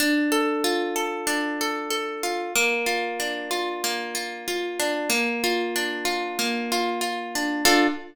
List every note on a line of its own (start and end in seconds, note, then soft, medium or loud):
0.00 1.26 D4 loud
0.32 0.95 A4 medium
0.64 2.23 F4 medium
0.96 1.60 A4 medium
1.27 2.48 D4 loud
1.61 1.90 A4 medium
1.90 2.51 A4 medium
2.23 2.54 F4 medium
2.55 3.83 A#3 loud
2.86 3.50 F4 medium
3.20 4.79 D4 medium
3.51 4.14 F4 medium
3.84 5.05 A#3 medium
4.15 4.47 F4 medium
4.48 5.08 F4 medium
4.80 5.10 D4 medium
5.10 6.38 A#3 loud
5.44 6.05 F4 medium
5.76 7.35 D4 medium
6.05 6.71 F4 medium
6.39 7.60 A#3 medium
6.72 7.01 F4 medium
7.01 7.62 F4 medium
7.35 7.65 D4 medium
7.65 7.87 D4 loud
7.65 7.87 F4 loud
7.65 7.87 A4 loud